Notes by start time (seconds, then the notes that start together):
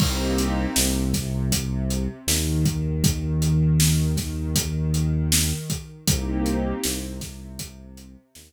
0.00 C2 A#3 C4 D#4 G4, kick, crash
0.38 closed hi-hat
0.75 C2 C3, snare
1.14 kick, snare, closed hi-hat
1.52 kick, closed hi-hat
1.90 closed hi-hat
2.27 D#2 D#3, snare
2.66 kick, closed hi-hat
3.04 kick, closed hi-hat
3.42 closed hi-hat
3.80 snare
4.17 kick, snare, closed hi-hat
4.56 kick, closed hi-hat
4.94 closed hi-hat
5.32 snare
5.70 kick, closed hi-hat
6.07 C2 A#3 C4 D#4 G4, kick, closed hi-hat
6.46 closed hi-hat
6.83 C2 C3, snare
7.21 kick, snare, closed hi-hat
7.59 kick, closed hi-hat
7.97 closed hi-hat
8.35 D#2 D#3, snare